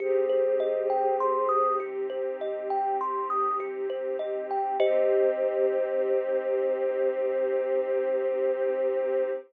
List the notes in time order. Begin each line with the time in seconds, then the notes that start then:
0.00 C2 C4 D#4 G4 G#4 C5
0.29 C5
0.60 D#5
0.90 G5
1.20 C6
1.49 D#6
1.80 G4
2.10 C5
2.40 C2 D#5
2.70 G5
3.01 C6
3.30 D#6
3.60 G4
3.90 C5
4.19 D#5
4.51 G5
4.80 C2 C4 D#4 G4 C5 D#5